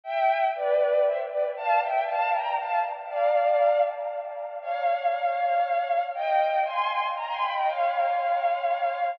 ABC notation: X:1
M:3/4
L:1/16
Q:1/4=118
K:F
V:1 name="Violin"
[eg]4 [=Bd]4 [ce] z [Bd] z | [fa]2 [eg]2 [fa]2 [gb]2 [fa]2 z2 | [df]6 z6 | [K:Fm] [df]12 |
[eg]4 [ac']4 b [ac'] [g=b] [eg] | [df]12 |]